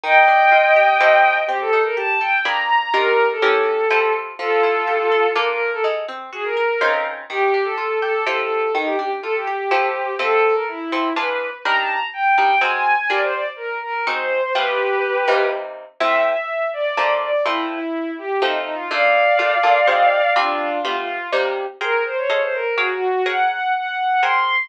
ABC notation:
X:1
M:3/4
L:1/16
Q:1/4=124
K:Fmix
V:1 name="Violin"
[eg]12 | G A2 B a2 g2 (3b2 b2 b2 | B3 A7 z2 | [FA]8 B B2 A |
z4 _A B5 z2 | G3 A3 A2 A A3 | E G G z A G7 | A3 B =E4 =B3 z |
b a b z g2 g2 _a a2 a | d c d z B2 B2 c c2 c | [G=B]8 z4 | =e2 e4 d4 d2 |
=E2 E4 G2 (3_E2 E2 F2 | [df]12 | [DF]4 F F3 z4 | [K:Abmix] B2 c d d c B2 (3G2 G2 G2 |
g2 g2 g4 c'4 |]
V:2 name="Acoustic Guitar (steel)"
E,2 D2 F2 G2 [F,=EGA]4 | C2 E2 G2 A2 [B,D_A_c]4 | [E,DFG]4 [=E,_DGB]4 [F,=EGA]4 | F,2 =E2 G2 A2 [B,DFA]4 |
_A,2 C2 _G2 B2 [_D,CEF]4 | E,2 D2 F2 G2 [F,=EGA]4 | E,2 D2 F2 G2 [F,=EGA]4 | [F,C=EA]6 [F,CEA]2 [=E,DF^G]4 |
[G,DEB]6 [G,DEB]2 [_A,C_GB]4 | [G,DFB]8 [_A,CE_G]4 | [G,A,=B,F]6 [C,G,_B,E]6 | [A,,F,C=E]8 [F,A,B,D]4 |
[F,A,C=E]8 [F,A,C_E]4 | [B,,A,DF]4 [B,,A,DF]2 [B,,A,DF]2 [_A,CE_G]4 | [G,CDF]4 [G,A,=B,F]4 [C,G,_B,E]4 | [K:Abmix] [ABc=g]4 [A=Acef]4 [_ABdf]4 |
[ABdg]8 [ABc=g]4 |]